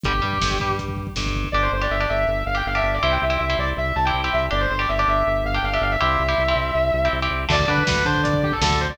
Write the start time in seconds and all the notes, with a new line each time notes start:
0.03 G1 D3 G3 G4, kick, closed hi-hat
0.14 kick
0.22 G2 G3, kick
0.33 kick
0.42 G1 G2, kick, snare
0.51 kick
0.60 G2 G3, kick
0.70 kick
0.79 kick, closed hi-hat
0.88 kick
0.97 kick
1.07 kick
1.16 G1 G2, kick, snare
1.26 kick
1.35 kick
1.44 kick
1.52 G1 D4 G4 D5
1.62 C5
1.72 G1 C5
1.82 D4 G4 D5
1.90 G1 E5
2.00 D4 G4 D5
2.09 G1 E5
2.27 G1
2.46 G1 F5
2.55 D4 G4 G5
2.66 G1 F5
2.75 D4 G4 E5
2.83 G1 E5
2.94 D5
3.03 C2 C4 E4 G4 E5
3.12 G5
3.22 C2 E5
3.30 C4 E4 G4
3.38 C2 E5
3.50 C4 E4 G4
3.58 C2 D5
3.77 C2 E5
3.96 C2 A5
4.05 C4 E4 G4 G5
4.14 C2
4.24 C4 E4 G4
4.33 C2 E5
4.51 G1 D4 G4 D5
4.61 C5
4.70 G1 C5
4.79 D4 G4 D5
4.89 G1 E5
4.98 D4 G4 D5
5.07 G1 E5
5.27 G1
5.44 G1 F5
5.54 D4 G4 G5
5.63 G1 F5
5.73 D4 G4 E5
5.81 G1 F5
5.91 E5
6.01 C2 C4 E4 G4 E5
6.19 C2
6.28 C4 E4 G4
6.38 C2
6.48 C4 E4 G4
6.56 C2
6.75 C2
6.93 C2
7.05 C4 E4 G4
7.13 C2
7.22 C4 E4 G4
7.31 C2
7.49 D2 D3 A3 D5, kick, crash
7.60 kick
7.68 D3 D4 B4, kick
7.78 kick
7.87 D2 D3 B4, kick, snare
7.96 kick
8.05 D3 D4 C5, kick
8.15 kick
8.23 D5, kick, closed hi-hat
8.33 kick
8.43 G4, kick
8.52 A4, kick
8.61 D2 D3 A4, kick, snare
8.71 kick
8.80 C5, kick
8.90 D5, kick